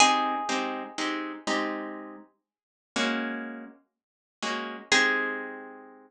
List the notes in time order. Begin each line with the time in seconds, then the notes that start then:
0.00 G#3 C4 D#4 G4 G#4
0.49 G#3 C4 D#4 G4
0.98 G#3 C4 D#4 G4
1.47 G#3 C4 D#4 G4
2.96 G#3 A#3 C#4 F#4
4.42 G#3 A#3 C#4 F#4
4.92 G#3 C4 D#4 G4 G#4